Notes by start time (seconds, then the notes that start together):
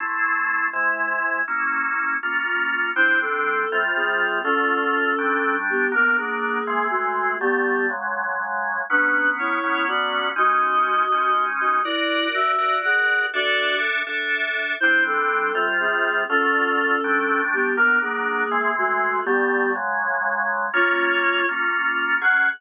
0.00 A3 C4 E4
0.73 C3 G#3 E4
1.48 A#3 C#4 E4
2.23 A#3 C#4 F4
2.96 G3 C4 D4 E4 C5
3.21 C4 A4
3.72 C3 G3 F4
3.96 C4 G#4
4.43 D3 A3 C#4 F4 A4
5.18 G3 A3 D4
5.70 B3 G4
5.92 F#3 A#3 B3 D4 A#4
6.17 A#3 G#4
6.67 E3 G#3 C4
6.90 A3 F#4
7.40 D3 G3 A3 B3 G4
7.90 C#3 F#3 G#3
8.90 F#3 B3 C#4 D4 B4
9.39 E4 C#5
9.63 F#3 B3 C#4
9.88 F#4 D5
10.36 G#3 C#4 D#4 F#4 D#5
11.12 G#3 C#4 D#4
11.60 F#4 D#5
11.84 E4 F#4 A#4 D5
12.34 F#4 E5
12.58 F#4 A#4 D5
12.85 G#4 F#5
13.34 D4 F#4 A4 D5 E5
14.07 D4 A4 E5
14.80 G3 C4 D4 E4 C5
15.06 C4 A4
15.55 C3 G3 F4
15.80 C4 G#4
16.29 D3 A3 C#4 F4 A4
17.04 G3 A3 D4
17.53 B3 G4
17.77 F#3 A#3 B3 D4 A#4
18.01 A#3 G#4
18.51 E3 G#3 C4
18.78 A3 F#4
19.25 D3 G3 A3 B3 G4
19.75 C#3 F#3 G#3
20.74 A#3 C#4 F4 C#5
21.49 A#3 C#4 F4
22.21 F#3 C#4 G#4 F#5